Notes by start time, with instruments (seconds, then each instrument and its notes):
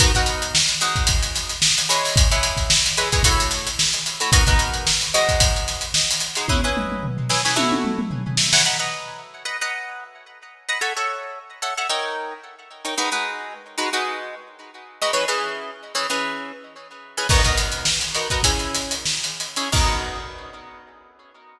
0.00 acoustic guitar (steel) B3 D#4 F#4 A#4, kick, closed hi-hat
0.15 acoustic guitar (steel) B3 D#4 F#4 A#4, kick, closed hi-hat
0.26 closed hi-hat
0.42 closed hi-hat
0.55 snare
0.69 closed hi-hat
0.81 acoustic guitar (steel) G#3 D#4 F#4 C5, closed hi-hat
0.96 kick, closed hi-hat
1.07 kick, closed hi-hat
1.23 closed hi-hat
1.35 snare, closed hi-hat
1.49 snare, closed hi-hat
1.62 snare
1.78 closed hi-hat
1.89 acoustic guitar (steel) G#3 E4 B4 C#5, closed hi-hat
2.04 snare, open hi-hat
2.16 kick, closed hi-hat
2.31 acoustic guitar (steel) G#3 E4 B4 C#5, closed hi-hat
2.43 closed hi-hat
2.57 kick, snare, closed hi-hat
2.70 snare
2.86 closed hi-hat
2.97 acoustic guitar (steel) G#3 E4 B4 C#5, closed hi-hat
3.12 acoustic guitar (steel) G#3 E4 B4 C#5, kick, closed hi-hat
3.23 acoustic guitar (steel) A3 E4 F#4 C#5, kick, closed hi-hat
3.40 closed hi-hat
3.51 snare, closed hi-hat
3.66 snare, closed hi-hat
3.79 snare
3.93 closed hi-hat
4.06 closed hi-hat
4.20 acoustic guitar (steel) A3 E4 F#4 C#5, closed hi-hat
4.32 acoustic guitar (steel) B3 D#4 F#4 A#4, kick, closed hi-hat
4.47 acoustic guitar (steel) B3 D#4 F#4 A#4, kick, snare, closed hi-hat
4.59 closed hi-hat
4.74 closed hi-hat
4.87 snare
5.01 closed hi-hat
5.14 acoustic guitar (steel) G#3 D#4 F#4 C5, closed hi-hat
5.29 kick, closed hi-hat
5.40 kick, closed hi-hat
5.56 closed hi-hat
5.68 snare, closed hi-hat
5.81 closed hi-hat
5.94 snare
6.11 closed hi-hat
6.20 closed hi-hat
6.35 acoustic guitar (steel) G#3 D#4 F#4 C5, closed hi-hat
6.48 acoustic guitar (steel) C#4 E4 G#4 B4, kick, high tom
6.64 acoustic guitar (steel) C#4 E4 G#4 B4
6.77 mid tom
6.92 mid tom
7.03 floor tom
7.17 floor tom
7.29 acoustic guitar (steel) C#4 E4 G#4 B4, snare
7.45 acoustic guitar (steel) C#4 E4 G#4 B4, snare
7.56 acoustic guitar (steel) A3 E4 F#4 C#5, high tom
7.72 high tom
7.85 mid tom
7.99 mid tom
8.11 floor tom
8.27 floor tom
8.37 snare
8.53 acoustic guitar (steel) A3 E4 F#4 C#5, snare
8.65 acoustic guitar (steel) B4 D#5 F#5 A#5
8.79 acoustic guitar (steel) B4 D#5 F#5 A#5
9.45 acoustic guitar (steel) B4 D#5 F#5 A#5
9.61 acoustic guitar (steel) B4 D#5 F#5 A#5
10.69 acoustic guitar (steel) B4 D#5 F#5 A#5
10.81 acoustic guitar (steel) A4 C#5 E5 F#5
10.97 acoustic guitar (steel) A4 C#5 E5 F#5
11.62 acoustic guitar (steel) A4 C#5 E5 F#5
11.77 acoustic guitar (steel) A4 C#5 E5 F#5
11.89 acoustic guitar (steel) D#4 A#4 C#5 G5
12.85 acoustic guitar (steel) D#4 A#4 C#5 G5
12.98 acoustic guitar (steel) G#3 D#4 F#4 B4
13.12 acoustic guitar (steel) G#3 D#4 F#4 B4
13.78 acoustic guitar (steel) G#3 D#4 F#4 B4
13.93 acoustic guitar (steel) G#3 D#4 F#4 B4
15.02 acoustic guitar (steel) G#3 D#4 F#4 B4
15.13 acoustic guitar (steel) E3 C#4 G#4 B4
15.28 acoustic guitar (steel) E3 C#4 G#4 B4
15.95 acoustic guitar (steel) E3 C#4 G#4 B4
16.10 acoustic guitar (steel) E3 C#4 G#4 B4
17.17 acoustic guitar (steel) E3 C#4 G#4 B4
17.29 acoustic guitar (steel) B3 D#4 F#4 A#4, kick, crash
17.43 acoustic guitar (steel) B3 D#4 F#4 A#4, kick, snare, closed hi-hat
17.57 closed hi-hat
17.72 closed hi-hat
17.85 snare
18.01 closed hi-hat
18.14 acoustic guitar (steel) B3 D#4 F#4 A#4, snare, closed hi-hat
18.30 acoustic guitar (steel) B3 D#4 F#4 A#4, kick, closed hi-hat
18.43 acoustic guitar (steel) C#4 E4 G#4, kick, closed hi-hat
18.59 snare, closed hi-hat
18.74 snare, closed hi-hat
18.91 closed hi-hat
19.05 snare
19.24 closed hi-hat
19.40 closed hi-hat
19.56 acoustic guitar (steel) C#4 E4 G#4, closed hi-hat
19.72 acoustic guitar (steel) B3 D#4 F#4 A#4, kick, crash